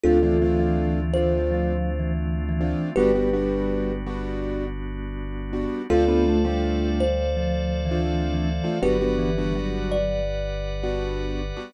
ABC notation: X:1
M:4/4
L:1/16
Q:1/4=82
K:Ddor
V:1 name="Kalimba"
[FA]6 c6 z4 | [GB]6 z10 | [FA]6 c6 z4 | [GB]6 d6 z4 |]
V:2 name="Vibraphone"
z E, E, E,5 (3F,4 E,4 E,4 | G,6 z10 | z B, A, G,5 (3F,4 E,4 E,4 | ^F,2 E,2 F,4 z8 |]
V:3 name="Acoustic Grand Piano"
[A,CDF] [A,CDF] [A,CDF]4 [A,CDF]8 [A,CDF]2 | [G,B,D^F] [G,B,DF] [G,B,DF]4 [G,B,DF]8 [G,B,DF]2 | [A,CDF] [A,CDF]2 [A,CDF]8 [A,CDF]4 [A,CDF] | [G,B,D^F] [G,B,DF]2 [G,B,DF]8 [G,B,DF]4 [G,B,DF] |]
V:4 name="Synth Bass 2" clef=bass
D,,16 | G,,,16 | D,,16 | G,,,16 |]
V:5 name="Drawbar Organ"
[A,CDF]16 | [G,B,D^F]16 | [Acdf]16 | [GBd^f]16 |]